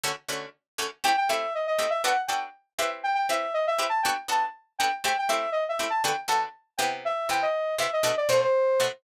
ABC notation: X:1
M:4/4
L:1/16
Q:1/4=120
K:Ador
V:1 name="Lead 2 (sawtooth)"
z8 | g g e2 ^d d2 e f z g z3 e z | g g e2 ^d e2 a g z a z3 g z | g g e2 ^d e2 a g z a z3 g z |
e2 g ^d3 e _e2 =d c c4 z |]
V:2 name="Pizzicato Strings"
[D,A,^CF]2 [D,A,CF]4 [D,A,CF]2 | [A,CEG]2 [A,CEG]4 [A,CEG]2 [B,DFA]2 [B,DFA]4 [CEGB]2- | [CEGB]2 [CEGB]4 [CEGB]2 [B,DFA]2 [B,DFA]4 [B,DFA]2 | [A,CEG]2 [A,CEG]4 [A,CEG]2 [D,B,FA]2 [D,B,FA]4 [C,B,EG]2- |
[C,B,EG]2 [C,B,EG]4 [C,B,EG]2 [B,,A,DF]2 [B,,A,DF]4 [B,,A,DF]2 |]